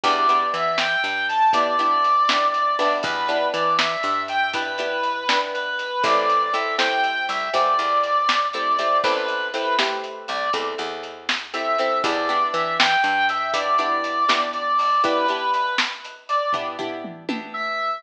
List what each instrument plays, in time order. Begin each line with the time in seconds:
0.03 electric bass (finger) E2, acoustic guitar (steel) B3 D4 E4 G4, brass section D5, kick, closed hi-hat
0.29 acoustic guitar (steel) B3 D4 E4 G4, closed hi-hat
0.54 electric bass (finger) E3, brass section E5, closed hi-hat
0.78 brass section G5, snare
1.04 electric bass (finger) G2, closed hi-hat
1.29 brass section A5, closed hi-hat
1.53 acoustic guitar (steel) B3 D4 E4 G4, brass section D5, kick, closed hi-hat
1.79 acoustic guitar (steel) B3 D4 E4 G4, closed hi-hat
2.04 closed hi-hat
2.29 acoustic guitar (steel) B3 D4 E4 G4, snare
2.54 brass section D5, closed hi-hat
2.79 acoustic guitar (steel) B3 D4 E4 G4, open hi-hat
3.03 electric bass (finger) E2, brass section B4, kick, closed hi-hat
3.28 acoustic guitar (steel) B3 D4 E4 G4, closed hi-hat
3.53 electric bass (finger) E3, brass section D5, closed hi-hat
3.79 brass section E5, snare
4.03 electric bass (finger) G2, closed hi-hat
4.28 brass section G5, closed hi-hat
4.53 acoustic guitar (steel) B3 D4 E4 G4, brass section B4, kick, closed hi-hat
4.78 acoustic guitar (steel) B3 D4 E4 G4, closed hi-hat
5.03 closed hi-hat
5.29 acoustic guitar (steel) B3 D4 E4 G4, snare
5.54 brass section B4, closed hi-hat
5.79 closed hi-hat
6.03 electric bass (finger) A1, acoustic guitar (steel) A3 C4 E4 G4, brass section D5, kick, closed hi-hat
6.29 closed hi-hat
6.54 acoustic guitar (steel) A3 C4 E4 G4, brass section E5, closed hi-hat
6.79 acoustic guitar (steel) A3 C4 E4 G4, brass section G5, snare
7.04 closed hi-hat
7.29 electric bass (finger) C2, brass section E5, closed hi-hat
7.53 electric bass (finger) E2, acoustic guitar (steel) A3 C4 E4 G4, brass section D5, kick, closed hi-hat
7.79 electric bass (finger) E2, closed hi-hat
8.03 closed hi-hat
8.29 snare
8.53 acoustic guitar (steel) A3 C4 E4 G4, brass section D5, closed hi-hat
8.79 acoustic guitar (steel) A3 C4 E4 G4, closed hi-hat
9.03 electric bass (finger) A1, acoustic guitar (steel) A3 C4 E4 G4, brass section B4, kick, closed hi-hat
9.28 closed hi-hat
9.54 acoustic guitar (steel) A3 C4 E4 G4, brass section B4, closed hi-hat
9.79 acoustic guitar (steel) A3 C4 E4 G4, snare
10.04 closed hi-hat
10.28 electric bass (finger) C2, brass section D5, closed hi-hat
10.53 electric bass (finger) E2, acoustic guitar (steel) A3 C4 E4 G4, kick, closed hi-hat
10.78 electric bass (finger) E2, closed hi-hat
11.03 closed hi-hat
11.29 snare
11.54 acoustic guitar (steel) A3 C4 E4 G4, brass section E5, closed hi-hat
11.78 acoustic guitar (steel) A3 C4 E4 G4, closed hi-hat
12.04 electric bass (finger) E2, acoustic guitar (steel) B3 D4 E4 G4, brass section D5, kick, closed hi-hat
12.29 acoustic guitar (steel) B3 D4 E4 G4, closed hi-hat
12.54 electric bass (finger) E3, brass section E5, closed hi-hat
12.79 brass section G5, snare
13.04 electric bass (finger) G2, closed hi-hat
13.29 brass section E5, closed hi-hat
13.53 acoustic guitar (steel) B3 D4 E4 G4, brass section D5, kick, closed hi-hat
13.78 acoustic guitar (steel) B3 D4 E4 G4, closed hi-hat
14.04 closed hi-hat
14.29 acoustic guitar (steel) B3 D4 E4 G4, snare
14.53 brass section D5, closed hi-hat
14.79 open hi-hat
15.04 acoustic guitar (steel) B3 D4 E4 G4, brass section B4, kick, closed hi-hat
15.28 acoustic guitar (steel) B3 D4 E4 G4, closed hi-hat
15.54 brass section B4, closed hi-hat
15.78 snare
16.04 closed hi-hat
16.29 brass section D5, closed hi-hat
16.53 acoustic guitar (steel) B3 D4 E4 G4, kick, floor tom
16.79 acoustic guitar (steel) B3 D4 E4 G4, floor tom
17.04 mid tom
17.29 acoustic guitar (steel) B3 D4 E4 G4, high tom
17.54 brass section E5